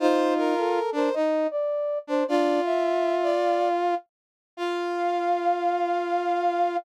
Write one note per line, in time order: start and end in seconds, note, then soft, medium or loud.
0.00 0.54 D#4 medium
0.00 0.79 F4 loud
0.00 0.34 C5 loud
0.37 0.90 A#4 loud
0.58 0.92 A4 medium
0.92 1.09 D4 loud
0.92 1.12 A#4 medium
0.92 1.15 C5 medium
1.14 1.47 D#4 medium
1.14 1.48 D#5 medium
1.51 1.98 D5 medium
2.07 2.24 D4 medium
2.07 2.26 C5 medium
2.28 2.60 D4 medium
2.28 3.95 F4 loud
2.28 2.61 D5 loud
2.65 3.16 E5 loud
2.65 3.32 E5 medium
3.23 3.69 D5 loud
3.43 3.97 F5 medium
4.57 6.77 F4 loud
4.57 6.77 F5 loud
4.57 6.78 F5 loud